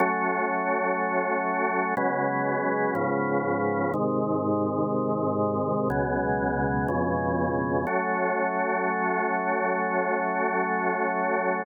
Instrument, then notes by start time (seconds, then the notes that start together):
drawbar organ
0.00 F#3 A3 C#4
1.97 C#3 F#3 G#3 B3
2.95 G#2 C#3 F3 B3
3.94 G#2 C3 D#3
5.90 C#2 B2 F#3 G#3
6.88 F2 B2 C#3 G#3
7.87 F#3 A3 C#4